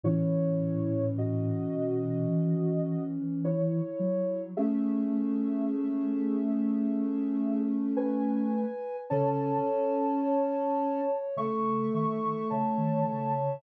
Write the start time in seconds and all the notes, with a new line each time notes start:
0.04 A2 E3 C#4 E4 C#5
1.18 F#4 D#5
1.73 B2
2.30 E3
3.45 E4 C#5
4.00 F#3
4.57 A3 C#4 G#4 E5
7.96 B4 G#5
9.10 C#3 C#4 A4 C#5 A5
10.23 C#5
11.37 C#3 A3 A4 E5 C#6
11.94 D#3 E5 C#6
12.50 C#3 C#5 E5 A5
12.78 D#3
13.07 C#3